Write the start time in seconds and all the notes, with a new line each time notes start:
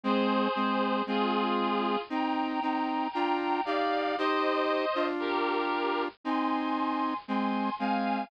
0.03 G#3 C4 G#4 C5
0.56 G#3 C4
1.06 G#3 C4 F4 G#4
2.09 C4 D#4 G5 A#5
2.62 C4 D#4
3.12 D4 F4 G5 A#5
3.65 D#4 G4 D5 F5
4.18 D#4 G4 C5 D#5
4.95 D4 F4
5.19 G4 A#4
6.24 C4 D#4 G#5 C6
7.28 G#3 C4 G#5 C6
7.79 G#3 C4 F5 G#5